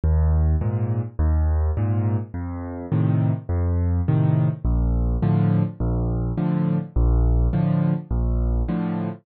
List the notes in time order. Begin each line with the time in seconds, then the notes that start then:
0.04 D#2
0.61 G#2 A#2
1.19 D#2
1.77 G#2 A#2
2.34 F2
2.92 A2 C3 D#3
3.49 F2
4.08 A2 C3 D#3
4.65 A#1
5.22 A2 D3 F3
5.80 A#1
6.37 A2 D3 F3
6.96 A#1
7.53 A2 D3 F3
8.11 A#1
8.68 A2 D3 F3